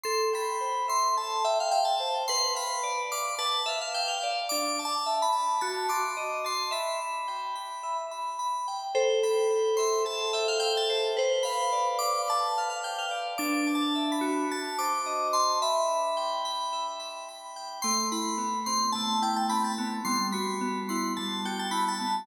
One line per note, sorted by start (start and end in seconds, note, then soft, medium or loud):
0.03 0.33 A4 medium
0.03 0.29 C6 loud
0.33 0.61 G5 medium
0.33 0.86 B5 medium
0.61 0.88 C5 medium
0.88 1.16 E5 medium
0.88 1.15 C6 medium
1.17 1.45 A4 medium
1.17 1.44 A5 medium
1.44 1.58 E5 medium
1.44 1.72 G5 medium
1.60 1.73 F5 medium
1.71 2.01 E5 medium
1.71 1.85 G5 loud
1.85 2.09 A5 medium
2.00 2.26 C5 medium
2.28 2.57 B4 medium
2.28 2.53 C6 loud
2.55 2.83 F5 medium
2.55 3.01 B5 medium
2.83 3.11 D5 medium
3.12 3.39 F5 medium
3.12 3.35 D6 medium
3.39 3.66 B4 medium
3.39 3.61 A5 medium
3.66 3.79 E5 medium
3.66 3.94 F5 medium
3.81 3.95 F5 medium
3.94 4.23 F5 medium
3.94 4.08 G5 medium
4.08 4.31 F5 medium
4.23 4.50 D5 medium
4.49 4.79 D4 medium
4.49 4.80 D6 loud
4.79 5.07 A5 medium
4.85 5.19 A5 medium
5.06 5.34 E5 medium
5.22 5.58 B5 medium
5.33 5.59 A5 medium
5.61 5.90 F#4 medium
5.61 5.87 A5 loud
5.89 6.16 C6 medium
5.89 6.39 D6 medium
6.17 6.45 D#5 medium
6.44 6.71 A5 medium
6.44 6.72 C6 medium
6.71 6.99 E5 medium
6.71 7.97 B5 loud
7.02 7.29 B5 medium
7.28 7.56 G5 medium
7.55 7.83 B5 medium
7.83 8.11 E5 medium
8.11 8.38 B5 medium
8.39 8.67 B5 medium
8.68 8.94 G5 medium
8.95 10.04 A4 loud
8.95 9.20 C5 loud
9.23 10.34 G5 medium
9.23 9.75 B5 medium
9.51 10.89 C5 medium
9.77 10.62 E5 medium
9.77 10.03 C6 medium
10.05 11.10 A4 medium
10.05 10.32 A5 medium
10.33 10.46 E5 medium
10.33 11.13 G5 medium
10.48 10.61 F5 medium
10.60 11.15 E5 medium
10.60 10.73 G5 loud
10.77 11.01 A5 medium
10.90 11.16 C5 medium
11.17 12.27 B4 medium
11.17 11.44 C5 loud
11.43 12.00 F5 medium
11.43 11.88 B5 medium
11.73 13.11 D5 medium
11.99 12.83 F5 medium
11.99 12.22 D6 medium
12.28 13.33 B4 medium
12.28 12.52 A5 medium
12.58 12.69 F5 medium
12.70 12.83 F5 medium
12.83 13.36 F5 medium
12.83 12.97 G5 medium
12.98 13.21 F5 medium
13.11 13.38 D5 medium
13.38 14.44 D4 loud
13.38 13.68 D6 loud
13.67 14.46 A5 medium
13.75 14.08 A5 medium
13.95 14.48 E5 medium
14.12 14.47 B5 medium
14.21 15.54 F#4 medium
14.51 14.77 A5 loud
14.78 15.58 C5 medium
14.78 15.28 D6 medium
15.06 15.59 D#5 medium
15.33 15.60 A5 medium
15.33 15.59 C6 medium
15.62 16.72 E5 loud
15.62 16.87 B5 loud
15.88 16.44 B5 medium
16.17 17.56 G5 medium
16.45 16.99 B5 medium
16.73 17.78 E5 medium
17.00 17.28 B5 medium
17.29 17.81 B5 medium
17.56 17.83 G5 medium
17.82 18.95 A3 medium
17.82 18.09 C6 loud
18.12 19.21 E4 medium
18.12 18.59 B5 medium
18.38 19.78 B3 medium
18.66 19.50 C4 medium
18.66 18.90 C6 medium
18.92 20.01 A3 medium
18.92 19.18 A5 medium
19.22 20.01 E4 medium
19.22 19.36 G5 medium
19.36 19.50 A5 medium
19.49 20.03 C4 medium
19.49 19.63 B5 medium
19.64 19.88 A5 medium
19.78 20.05 B3 medium
20.05 21.18 G3 medium
20.05 20.27 C6 loud
20.32 21.45 F#4 medium
20.32 20.80 B5 medium
20.61 22.00 B3 medium
20.89 21.71 E4 medium
20.89 21.13 C6 medium
21.17 22.24 G3 medium
21.17 21.41 A5 medium
21.45 22.25 F#4 medium
21.45 21.59 G5 medium
21.59 21.73 A5 medium
21.71 22.24 E4 medium
21.71 21.84 B5 medium
21.88 22.15 A5 medium
22.00 22.26 B3 medium